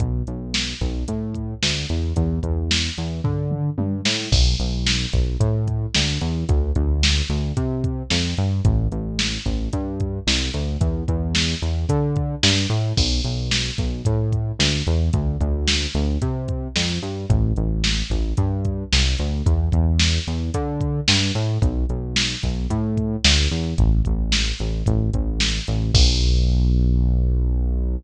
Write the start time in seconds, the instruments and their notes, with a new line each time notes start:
0.00 synth bass 1 B1, kick, closed hi-hat
0.27 synth bass 1 B1, closed hi-hat
0.54 snare
0.81 synth bass 1 B1, kick, closed hi-hat
1.08 synth bass 1 A2, kick, closed hi-hat
1.34 kick, closed hi-hat
1.63 synth bass 1 D2, snare
1.89 synth bass 1 E2, closed hi-hat
2.16 synth bass 1 E2, kick, closed hi-hat
2.43 synth bass 1 E2, kick, closed hi-hat
2.71 snare
2.98 synth bass 1 E2, closed hi-hat
3.24 synth bass 1 D3, kick, floor tom
3.51 mid tom
3.78 synth bass 1 G2, high tom
4.05 synth bass 1 A2, snare
4.32 synth bass 1 B1, kick, crash
4.60 synth bass 1 B1, closed hi-hat
4.86 snare
5.13 synth bass 1 B1, kick, closed hi-hat
5.40 synth bass 1 A2, kick, closed hi-hat
5.68 kick, closed hi-hat
5.94 synth bass 1 D2, snare
6.21 synth bass 1 E2, closed hi-hat
6.49 synth bass 1 D2, kick, closed hi-hat
6.75 synth bass 1 D2, kick, closed hi-hat
7.03 snare
7.29 synth bass 1 D2, closed hi-hat
7.57 synth bass 1 C3, kick, closed hi-hat
7.84 kick, closed hi-hat
8.10 synth bass 1 F2, snare
8.37 synth bass 1 G2, closed hi-hat
8.65 synth bass 1 A1, kick, closed hi-hat
8.92 synth bass 1 A1, closed hi-hat
9.19 snare
9.46 synth bass 1 A1, kick, closed hi-hat
9.73 synth bass 1 G2, kick, closed hi-hat
10.00 kick, closed hi-hat
10.27 synth bass 1 C2, snare
10.54 synth bass 1 D2, closed hi-hat
10.81 synth bass 1 E2, kick, closed hi-hat
11.08 synth bass 1 E2, kick, closed hi-hat
11.35 snare
11.62 synth bass 1 E2, closed hi-hat
11.89 synth bass 1 D3, kick, closed hi-hat
12.16 kick, closed hi-hat
12.43 synth bass 1 G2, snare
12.70 synth bass 1 A2, closed hi-hat
12.97 synth bass 1 B1, kick, crash
13.24 synth bass 1 B1, closed hi-hat
13.51 snare
13.78 synth bass 1 B1, kick, closed hi-hat
14.05 synth bass 1 A2, kick, closed hi-hat
14.32 kick, closed hi-hat
14.59 synth bass 1 D2, snare
14.87 synth bass 1 E2, closed hi-hat
15.13 synth bass 1 D2, kick, closed hi-hat
15.41 synth bass 1 D2, kick, closed hi-hat
15.68 snare
15.95 synth bass 1 D2, closed hi-hat
16.22 synth bass 1 C3, kick, closed hi-hat
16.48 kick, closed hi-hat
16.76 synth bass 1 F2, snare
17.03 synth bass 1 G2, closed hi-hat
17.30 synth bass 1 A1, kick, closed hi-hat
17.56 synth bass 1 A1, closed hi-hat
17.84 snare
18.10 synth bass 1 A1, kick, closed hi-hat
18.37 synth bass 1 G2, kick, closed hi-hat
18.65 kick, closed hi-hat
18.92 synth bass 1 C2, snare
19.18 synth bass 1 D2, closed hi-hat
19.46 synth bass 1 E2, kick, closed hi-hat
19.72 synth bass 1 E2, kick, closed hi-hat
19.99 snare
20.27 synth bass 1 E2, closed hi-hat
20.54 synth bass 1 D3, kick, closed hi-hat
20.81 kick, closed hi-hat
21.08 synth bass 1 G2, snare
21.35 synth bass 1 A2, closed hi-hat
21.62 synth bass 1 B1, kick, closed hi-hat
21.89 synth bass 1 B1, closed hi-hat
22.16 snare
22.43 synth bass 1 B1, kick, closed hi-hat
22.70 synth bass 1 A2, kick, closed hi-hat
22.97 kick, closed hi-hat
23.24 synth bass 1 D2, snare
23.51 synth bass 1 E2, closed hi-hat
23.78 synth bass 1 A1, kick, closed hi-hat
24.05 synth bass 1 A1, kick, closed hi-hat
24.32 snare
24.59 synth bass 1 A1, closed hi-hat
24.86 synth bass 1 A1, kick, closed hi-hat
25.14 synth bass 1 A1, kick, closed hi-hat
25.40 snare
25.67 synth bass 1 A1, closed hi-hat
25.94 synth bass 1 B1, kick, crash